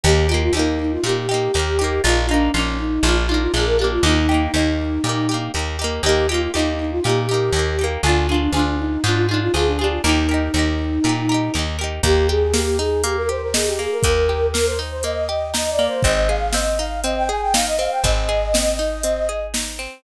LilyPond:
<<
  \new Staff \with { instrumentName = "Flute" } { \time 4/4 \key ees \major \tempo 4 = 120 g'8 f'16 f'16 ees'8 ees'16 f'16 g'2 | f'8 d'8 des'8 ees'8 f'16 f'16 ees'16 f'16 aes'16 bes'16 g'16 f'16 | ees'2. r4 | g'8 f'16 f'16 ees'8 ees'16 f'16 g'2 |
f'8 d'8 d'8 ees'8 f'16 f'16 ees'16 f'16 aes'16 d'16 g'16 f'16 | ees'2.~ ees'8 r8 | g'8 aes'8 g'8 aes'8 g'16 bes'16 c''16 bes'16 aes'16 g'16 aes'16 bes'16 | bes'4 bes'16 c''16 r16 c''16 ees''4 \tuplet 3/2 { ees''8 d''8 c''8 } |
ees''8 f''8 ees''8 f''8 ees''16 g''16 aes''16 g''16 f''16 ees''16 f''16 g''16 | ees''2. r4 | }
  \new Staff \with { instrumentName = "Pizzicato Strings" } { \time 4/4 \key ees \major <bes ees' g'>8 <bes ees' g'>8 <bes ees' g'>4 <bes ees' g'>8 <bes ees' g'>8 <bes ees' g'>8 <bes ees' g'>8 | <bes ees' f'>8 <bes ees' f'>8 <bes ees' f'>4 <bes d' f'>8 <bes d' f'>8 <bes d' f'>8 <bes d' f'>8 | <bes ees' g'>8 <bes ees' g'>8 <bes ees' g'>4 <bes ees' g'>8 <bes ees' g'>8 <bes ees' g'>8 <bes ees' g'>8 | <bes ees' g'>8 <bes ees' g'>8 <bes ees' g'>4 <bes ees' g'>8 <bes ees' g'>8 <bes ees' g'>8 <bes ees' g'>8 |
<d' f' aes'>8 <d' f' aes'>8 <d' f' aes'>4 <d' f' aes'>8 <d' f' aes'>8 <d' f' aes'>8 <d' f' aes'>8 | <ees' g' bes'>8 <ees' g' bes'>8 <ees' g' bes'>4 <ees' g' bes'>8 <ees' g' bes'>8 <ees' g' bes'>8 <ees' g' bes'>8 | bes8 g'8 bes8 ees'8 bes8 g'8 ees'8 bes8 | bes8 g'8 bes8 ees'8 bes8 g'8 ees'8 bes8 |
c'8 aes'8 c'8 ees'8 c'8 aes'8 ees'8 c'8 | c'8 aes'8 c'8 ees'8 c'8 aes'8 ees'8 c'8 | }
  \new Staff \with { instrumentName = "Electric Bass (finger)" } { \clef bass \time 4/4 \key ees \major ees,4 ees,4 bes,4 ees,4 | bes,,4 bes,,4 bes,,4 bes,,4 | ees,4 ees,4 bes,4 ees,4 | ees,4 ees,4 bes,4 ees,4 |
d,4 d,4 aes,4 d,4 | ees,4 ees,4 bes,4 ees,4 | ees,1 | ees,1 |
aes,,1 | aes,,1 | }
  \new DrumStaff \with { instrumentName = "Drums" } \drummode { \time 4/4 r4 r4 r4 r4 | r4 r4 r4 r4 | r4 r4 r4 r4 | r4 r4 r4 r4 |
r4 r4 r4 r4 | r4 r4 r4 r4 | <hh bd>4 sn4 hh4 sn4 | <hh bd>4 sn4 hh4 sn4 |
<hh bd>4 sn4 hh4 sn4 | <hh bd>4 sn4 hh4 sn4 | }
>>